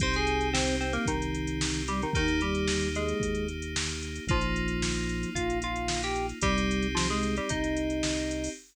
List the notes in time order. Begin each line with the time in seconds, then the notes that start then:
0.00 C2 C4 D#4 G4 C5 C6, kick, closed hi-hat
0.14 G#4 G#5, closed hi-hat
0.27 closed hi-hat
0.41 closed hi-hat
0.53 C4 C5, snare
0.68 closed hi-hat
0.80 C4 C5, closed hi-hat
0.93 A#3 A#4, closed hi-hat
1.06 C2 D#3 D#4, kick, closed hi-hat
1.22 closed hi-hat
1.34 closed hi-hat
1.47 closed hi-hat
1.61 snare
1.74 closed hi-hat
1.88 G3 G4, closed hi-hat
2.02 D#3 D#4, closed hi-hat
2.13 D#2 D#3 A#3 D#4 G4, kick, closed hi-hat
2.28 closed hi-hat
2.41 G3 G4, closed hi-hat
2.55 closed hi-hat
2.68 snare
2.81 closed hi-hat
2.95 G#3 G#4, closed hi-hat
3.08 closed hi-hat
3.20 D#2, kick, closed hi-hat
3.35 closed hi-hat
3.48 closed hi-hat
3.62 closed hi-hat
3.76 snare
3.89 closed hi-hat
4.03 closed hi-hat
4.16 closed hi-hat
4.27 A#1 F3 A#3 D#4 F4, kick, closed hi-hat
4.41 closed hi-hat
4.56 closed hi-hat
4.68 closed hi-hat
4.82 snare
4.96 closed hi-hat
5.09 closed hi-hat
5.23 closed hi-hat
5.35 A#1 F4 F5, kick, closed hi-hat
5.50 closed hi-hat
5.62 F4 F5, closed hi-hat
5.76 closed hi-hat
5.88 snare
6.03 G4 G5, closed hi-hat
6.16 closed hi-hat
6.29 closed hi-hat
6.41 C2 G3 C4 D#4 G4, kick, closed hi-hat
6.58 closed hi-hat
6.71 closed hi-hat
6.82 closed hi-hat
6.95 F3 F4, snare
7.10 G#3 G#4, closed hi-hat
7.23 closed hi-hat
7.36 G3 G4, closed hi-hat
7.49 C2 D#4 D#5, kick, closed hi-hat
7.64 closed hi-hat
7.77 closed hi-hat
7.90 closed hi-hat
8.03 snare
8.17 closed hi-hat
8.31 closed hi-hat
8.44 open hi-hat